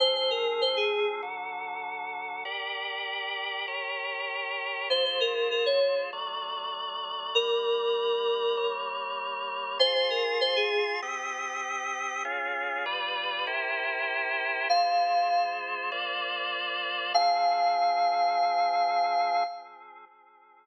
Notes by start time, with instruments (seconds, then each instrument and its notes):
0.00 drawbar organ F3 C4 G#4, electric piano 2 C5
0.15 electric piano 2 C5
0.31 electric piano 2 A#4
0.61 electric piano 2 C5
0.77 electric piano 2 G#4
1.22 drawbar organ D3 F#3 A4
2.45 drawbar organ G4 A#4 D5
3.67 drawbar organ G4 A#4 C#5
4.90 drawbar organ G#3 F4 C5, electric piano 2 C5
5.05 electric piano 2 C5
5.21 electric piano 2 A#4
5.51 electric piano 2 A#4
5.66 electric piano 2 C#5
6.13 drawbar organ F#3 A3 D5
7.35 drawbar organ G3 A#3 D5, electric piano 2 A#4
8.57 drawbar organ G3 A#3 C#5
9.79 drawbar organ F4 G#4 C6, electric piano 2 C5
9.95 electric piano 2 C5
10.10 electric piano 2 A#4
10.41 electric piano 2 C5
10.56 electric piano 2 G#4
11.02 drawbar organ C4 G4 D#6
12.25 drawbar organ C#4 F4 G#4
12.86 drawbar organ G3 F4 B4 D5
13.47 drawbar organ E4 G4 A#4 C5
14.69 drawbar organ G#3 F4 C5, electric piano 2 F5
15.92 drawbar organ A#3 F4 C5 D5
17.14 drawbar organ F3 C4 G#4, electric piano 2 F5